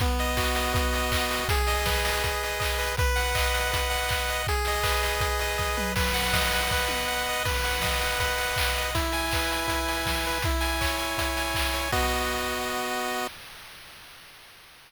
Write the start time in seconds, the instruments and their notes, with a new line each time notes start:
0.00 lead 1 (square) B3, kick, closed hi-hat
0.19 lead 1 (square) D#5, open hi-hat
0.37 lead 1 (square) F#4, kick, clap
0.55 lead 1 (square) D#5, open hi-hat
0.74 lead 1 (square) B3, kick, closed hi-hat
0.93 lead 1 (square) D#5, open hi-hat
1.12 lead 1 (square) D#5, kick, clap
1.31 lead 1 (square) F#4, open hi-hat
1.49 lead 1 (square) G#4, kick, closed hi-hat
1.67 lead 1 (square) D#5, open hi-hat
1.86 lead 1 (square) B4, kick, snare
2.04 lead 1 (square) D#5, open hi-hat
2.24 lead 1 (square) G#4, kick, closed hi-hat
2.43 lead 1 (square) D#5, open hi-hat
2.60 lead 1 (square) D#5, kick, clap
2.78 lead 1 (square) B4, open hi-hat
2.97 lead 1 (square) B4, kick, closed hi-hat
3.16 lead 1 (square) F#5, open hi-hat
3.35 lead 1 (square) D#5, kick, clap
3.54 lead 1 (square) F#5, open hi-hat
3.72 lead 1 (square) B4, kick, closed hi-hat
3.90 lead 1 (square) F#5, open hi-hat
4.09 lead 1 (square) F#5, kick, clap
4.28 lead 1 (square) D#5, open hi-hat
4.47 lead 1 (square) G#4, kick, closed hi-hat
4.65 lead 1 (square) D#5, open hi-hat
4.83 lead 1 (square) B4, kick, clap
5.03 lead 1 (square) D#5, open hi-hat
5.20 lead 1 (square) G#4, kick, closed hi-hat
5.39 lead 1 (square) D#5, open hi-hat
5.58 lead 1 (square) D#5, kick, snare
5.77 lead 1 (square) B4, mid tom
5.96 lead 1 (square) B4, kick, crash
6.14 lead 1 (square) F#5, open hi-hat
6.33 lead 1 (square) D#5, kick, snare
6.52 lead 1 (square) F#5, open hi-hat
6.71 lead 1 (square) B4, kick, snare
6.88 lead 1 (square) F#5, high tom
7.08 lead 1 (square) F#5
7.29 lead 1 (square) D#5
7.45 lead 1 (square) B4, kick, crash
7.64 lead 1 (square) F#5, open hi-hat
7.82 lead 1 (square) D#5, kick, snare
8.01 lead 1 (square) F#5, open hi-hat
8.20 lead 1 (square) B4, kick, closed hi-hat
8.37 lead 1 (square) F#5, open hi-hat
8.56 lead 1 (square) F#5, kick, clap
8.75 lead 1 (square) D#5, open hi-hat
8.95 lead 1 (square) E4, kick, closed hi-hat
9.12 lead 1 (square) G#5, open hi-hat
9.31 lead 1 (square) B4, kick, clap
9.52 lead 1 (square) G#5, open hi-hat
9.68 lead 1 (square) E4, kick, closed hi-hat
9.88 lead 1 (square) G#5, open hi-hat
10.06 lead 1 (square) G#5, kick, snare
10.24 lead 1 (square) B4, open hi-hat
10.42 lead 1 (square) E4, kick, closed hi-hat
10.61 lead 1 (square) G#5, open hi-hat
10.81 lead 1 (square) C#5, kick, clap
10.98 lead 1 (square) G#5, open hi-hat
11.18 lead 1 (square) E4, kick, closed hi-hat
11.37 lead 1 (square) G#5, open hi-hat
11.54 lead 1 (square) G#5, kick, clap
11.73 lead 1 (square) C#5, open hi-hat
11.92 lead 1 (square) B3 F#4 D#5, kick, crash